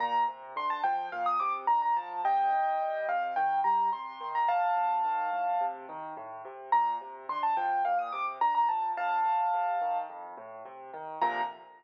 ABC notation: X:1
M:4/4
L:1/16
Q:1/4=107
K:Bb
V:1 name="Acoustic Grand Piano"
b2 z2 c' a g2 f e' d' z b b a2 | [eg]6 f2 g2 b2 c'3 b | [fa]10 z6 | b2 z2 c' a g2 f e' d' z b b a2 |
[fa]8 z8 | b4 z12 |]
V:2 name="Acoustic Grand Piano" clef=bass
B,,2 C,2 D,2 F,2 B,,2 C,2 D,2 F,2 | C,2 E,2 G,2 C,2 E,2 G,2 C,2 E,2 | A,,2 C,2 E,2 A,,2 C,2 E,2 A,,2 C,2 | B,,2 C,2 D,2 F,2 B,,2 C,2 D,2 F,2 |
F,,2 A,,2 C,2 E,2 F,,2 A,,2 C,2 E,2 | [B,,C,D,F,]4 z12 |]